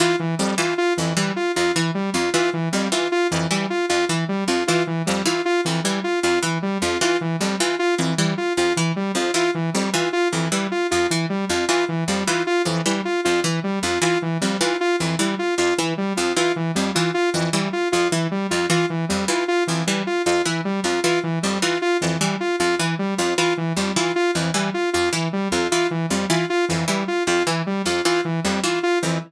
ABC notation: X:1
M:3/4
L:1/8
Q:1/4=154
K:none
V:1 name="Harpsichord" clef=bass
E, z F,, E, z F,, | E, z F,, E, z F,, | E, z F,, E, z F,, | E, z F,, E, z F,, |
E, z F,, E, z F,, | E, z F,, E, z F,, | E, z F,, E, z F,, | E, z F,, E, z F,, |
E, z F,, E, z F,, | E, z F,, E, z F,, | E, z F,, E, z F,, | E, z F,, E, z F,, |
E, z F,, E, z F,, | E, z F,, E, z F,, | E, z F,, E, z F,, | E, z F,, E, z F,, |
E, z F,, E, z F,, | E, z F,, E, z F,, | E, z F,, E, z F,, | E, z F,, E, z F,, |
E, z F,, E, z F,, | E, z F,, E, z F,, | E, z F,, E, z F,, | E, z F,, E, z F,, |
E, z F,, E, z F,, |]
V:2 name="Lead 2 (sawtooth)"
F E, G, F F E, | G, F F E, G, F | F E, G, F F E, | G, F F E, G, F |
F E, G, F F E, | G, F F E, G, F | F E, G, F F E, | G, F F E, G, F |
F E, G, F F E, | G, F F E, G, F | F E, G, F F E, | G, F F E, G, F |
F E, G, F F E, | G, F F E, G, F | F E, G, F F E, | G, F F E, G, F |
F E, G, F F E, | G, F F E, G, F | F E, G, F F E, | G, F F E, G, F |
F E, G, F F E, | G, F F E, G, F | F E, G, F F E, | G, F F E, G, F |
F E, G, F F E, |]